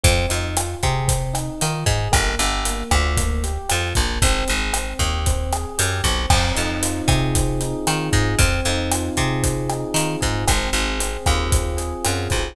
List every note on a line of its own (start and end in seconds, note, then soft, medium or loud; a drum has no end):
0.03 0.26 F2 loud
0.03 0.30 C4 medium
0.03 kick loud
0.03 closed hi-hat loud
0.29 0.75 F2 medium
0.29 0.55 D#4 medium
0.29 closed hi-hat medium
0.57 0.83 F4 medium
0.57 cross-stick loud
0.57 closed hi-hat loud
0.83 1.50 C3 loud
0.83 1.09 G#4 medium
0.83 kick medium
0.83 closed hi-hat medium
1.08 1.34 C4 medium
1.08 kick medium
1.08 closed hi-hat loud
1.33 1.60 D#4 medium
1.33 cross-stick medium
1.33 closed hi-hat medium
1.61 1.84 D#3 medium
1.61 1.87 F4 medium
1.61 closed hi-hat loud
1.86 2.08 G#2 loud
1.86 2.12 G#4 medium
1.86 kick medium
1.86 closed hi-hat medium
2.12 2.35 G1 loud
2.12 2.38 A#3 medium
2.12 kick medium
2.12 cross-stick loud
2.12 closed hi-hat loud
2.39 2.83 G1 loud
2.39 2.66 G4 medium
2.39 closed hi-hat medium
2.65 2.92 A#3 medium
2.65 closed hi-hat loud
2.91 3.58 D2 loud
2.91 3.17 F4 medium
2.91 kick medium
2.91 cross-stick loud
2.91 closed hi-hat medium
3.17 3.43 A#3 medium
3.17 kick medium
3.17 closed hi-hat loud
3.43 3.70 G4 medium
3.43 closed hi-hat medium
3.69 3.93 F2 medium
3.69 3.96 F4 medium
3.69 cross-stick medium
3.69 closed hi-hat loud
3.95 4.19 A#1 medium
3.95 4.22 A#3 medium
3.95 kick medium
3.95 closed hi-hat medium
4.22 4.44 G#1 loud
4.22 4.49 C4 loud
4.22 kick loud
4.22 closed hi-hat loud
4.48 4.94 G#1 medium
4.48 4.74 G#4 medium
4.48 closed hi-hat medium
4.74 5.00 C4 medium
4.74 cross-stick medium
4.74 closed hi-hat loud
4.99 5.66 D#2 medium
4.99 5.26 G4 medium
4.99 kick medium
4.99 closed hi-hat medium
5.26 5.53 C4 medium
5.26 kick medium
5.26 closed hi-hat loud
5.52 5.79 G#4 medium
5.52 cross-stick loud
5.52 closed hi-hat medium
5.78 6.02 F#2 loud
5.78 6.04 G4 medium
5.78 closed hi-hat loud
6.04 6.26 B1 loud
6.04 6.30 C4 medium
6.04 kick medium
6.04 closed hi-hat medium
6.30 6.52 F2 loud
6.30 7.34 C4 medium
6.30 kick loud
6.30 cross-stick loud
6.30 crash loud
6.55 7.02 F2 medium
6.55 7.61 D#4 medium
6.55 closed hi-hat medium
6.83 7.86 F4 medium
6.83 closed hi-hat loud
7.08 7.74 C3 loud
7.08 8.12 G#4 medium
7.08 kick medium
7.08 cross-stick medium
7.08 closed hi-hat medium
7.35 8.34 C4 medium
7.35 kick medium
7.35 closed hi-hat loud
7.61 8.36 D#4 medium
7.61 closed hi-hat medium
7.87 8.10 D#3 loud
7.87 8.37 F4 medium
7.87 cross-stick medium
7.87 closed hi-hat loud
8.12 8.35 G#2 loud
8.12 8.37 G#4 medium
8.12 kick medium
8.12 closed hi-hat medium
8.39 8.61 F2 loud
8.39 9.43 C4 medium
8.39 kick loud
8.39 closed hi-hat loud
8.65 9.10 F2 loud
8.65 9.70 D#4 medium
8.65 closed hi-hat medium
8.92 9.95 F4 medium
8.92 cross-stick loud
8.92 closed hi-hat loud
9.17 9.84 C3 loud
9.17 10.20 G#4 medium
9.17 kick medium
9.17 closed hi-hat medium
9.43 10.42 C4 medium
9.43 kick medium
9.43 closed hi-hat loud
9.70 10.45 D#4 medium
9.70 cross-stick medium
9.70 closed hi-hat medium
9.94 10.16 D#3 medium
9.94 10.45 F4 medium
9.94 closed hi-hat loud
10.21 10.45 G#2 medium
10.21 10.45 G#4 medium
10.21 kick medium
10.21 closed hi-hat medium
10.48 10.70 G#1 loud
10.48 10.99 C4 medium
10.48 kick medium
10.48 cross-stick loud
10.48 closed hi-hat loud
10.73 11.17 G#1 loud
10.73 11.77 G#4 medium
10.73 closed hi-hat medium
10.99 11.50 C4 medium
10.99 closed hi-hat loud
11.26 11.94 D#2 medium
11.26 12.04 F4 medium
11.26 kick medium
11.26 cross-stick medium
11.26 closed hi-hat medium
11.51 12.30 C4 medium
11.51 kick medium
11.51 closed hi-hat loud
11.77 12.51 G#4 medium
11.77 closed hi-hat medium
12.04 12.28 F#2 medium
12.04 12.54 F4 medium
12.04 cross-stick medium
12.04 closed hi-hat loud
12.30 12.54 B1 medium
12.30 12.55 C4 medium
12.30 kick medium
12.30 closed hi-hat medium